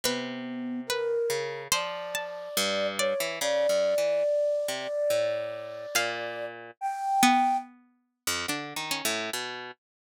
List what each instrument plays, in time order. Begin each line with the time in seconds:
0.04 orchestral harp C3, flute B3, pizzicato strings B4
0.87 flute A#4, pizzicato strings B4
1.30 orchestral harp C#3
1.72 orchestral harp F3, pizzicato strings C5, flute D5
2.15 pizzicato strings A5
2.57 orchestral harp G2
2.99 flute C#5, pizzicato strings D5
3.20 orchestral harp E3
3.41 orchestral harp C#3, pizzicato strings G#4, flute D5
3.69 orchestral harp F#2
3.98 orchestral harp E3
4.68 orchestral harp C3
5.10 orchestral harp A2
5.95 orchestral harp A#2, pizzicato strings F5
6.81 flute G5
7.23 pizzicato strings B3
8.27 orchestral harp F2
8.48 orchestral harp D3, pizzicato strings D4
8.76 orchestral harp D#3
8.91 pizzicato strings C#4
9.05 orchestral harp A2
9.33 orchestral harp B2